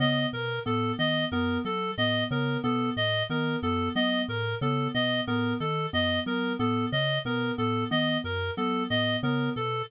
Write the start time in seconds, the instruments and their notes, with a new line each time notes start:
0.00 vibraphone C#3, electric piano 2 B3, clarinet D#5
0.33 vibraphone B2, clarinet A#4
0.66 vibraphone A2, electric piano 2 B3, clarinet A4
0.98 vibraphone D#3, electric piano 2 B3, clarinet D#5
1.32 vibraphone F#2, electric piano 2 B3, clarinet A#4
1.65 vibraphone F#3, clarinet A4
1.98 vibraphone A2, electric piano 2 B3, clarinet D#5
2.31 vibraphone C#3, electric piano 2 B3, clarinet A#4
2.63 vibraphone B2, electric piano 2 B3, clarinet A4
2.97 vibraphone A2, clarinet D#5
3.30 vibraphone D#3, electric piano 2 B3, clarinet A#4
3.63 vibraphone F#2, electric piano 2 B3, clarinet A4
3.95 vibraphone F#3, electric piano 2 B3, clarinet D#5
4.28 vibraphone A2, clarinet A#4
4.61 vibraphone C#3, electric piano 2 B3, clarinet A4
4.94 vibraphone B2, electric piano 2 B3, clarinet D#5
5.27 vibraphone A2, electric piano 2 B3, clarinet A#4
5.60 vibraphone D#3, clarinet A4
5.93 vibraphone F#2, electric piano 2 B3, clarinet D#5
6.26 vibraphone F#3, electric piano 2 B3, clarinet A#4
6.59 vibraphone A2, electric piano 2 B3, clarinet A4
6.92 vibraphone C#3, clarinet D#5
7.25 vibraphone B2, electric piano 2 B3, clarinet A#4
7.58 vibraphone A2, electric piano 2 B3, clarinet A4
7.91 vibraphone D#3, electric piano 2 B3, clarinet D#5
8.24 vibraphone F#2, clarinet A#4
8.57 vibraphone F#3, electric piano 2 B3, clarinet A4
8.90 vibraphone A2, electric piano 2 B3, clarinet D#5
9.23 vibraphone C#3, electric piano 2 B3, clarinet A#4
9.56 vibraphone B2, clarinet A4